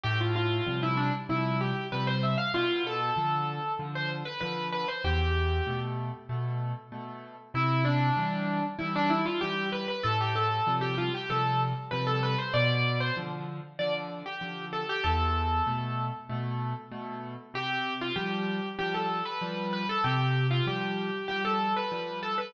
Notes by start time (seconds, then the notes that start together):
0.04 A2 G4
0.21 F4
0.36 F4
0.67 C3 F3 G3
0.83 E4
0.97 D4
1.29 C3 F3 G3 E4
1.61 G4
1.92 C3 F3 G3 B4
2.07 C5
2.23 E5
2.38 F5
2.54 B2 F4
2.87 A4
3.16 D3 F3
3.79 D3 F3
3.95 C5
4.25 B4
4.40 D3 F3 B4
4.72 B4
4.88 C5
5.04 E2 G4
5.67 B2 A3
6.29 B2 A3
6.92 B2 A3
7.54 C3 E4
7.85 D4
8.17 E3 G3
8.79 E3 G3 E4
8.96 D4
9.10 E4
9.26 F4
9.41 E3 G3 G4
9.72 B4
9.88 B4
10.04 A2 A4
10.21 G4
10.36 A4
10.67 C3 F3 G3
10.81 G4
10.98 F4
11.14 G4
11.30 C3 F3 G3 A4
11.91 C3 F3 G3 B4
12.07 A4
12.23 B4
12.38 C5
12.54 B2 D5
13.00 C5
13.17 D3 F3
13.79 D3 F3 D5
14.26 G4
14.41 D3 F3
14.73 A4
14.89 G4
15.04 E2 A4
15.67 B2 A3
16.29 B2 A3
16.92 B2 A3
17.54 C3 G4
18.01 F4
18.16 F3 G3 G4
18.79 F3 G3 G4
18.94 A4
19.25 B4
19.41 F3 G3
19.73 B4
19.89 A4
20.04 C3 G4
20.51 F4
20.67 F3 G3 G4
21.28 F3 G3 G4
21.45 A4
21.76 B4
21.92 F3 G3
22.23 A4
22.38 B4